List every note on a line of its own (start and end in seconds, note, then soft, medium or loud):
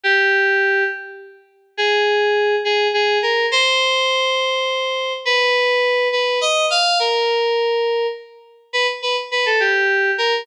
0.04 0.84 G4 medium
1.77 2.56 G#4 medium
2.65 2.88 G#4 medium
2.94 3.18 G#4 medium
3.22 3.46 A#4 medium
3.52 5.13 C5 medium
5.25 6.08 B4 medium
6.12 6.39 B4 medium
6.41 6.66 D#5 medium
6.70 6.98 F5 medium
7.00 8.07 A#4 medium
8.73 8.87 B4 medium
9.02 9.16 B4 medium
9.31 9.45 B4 medium
9.46 9.60 A4 medium
9.60 10.11 G4 medium
10.18 10.42 A#4 medium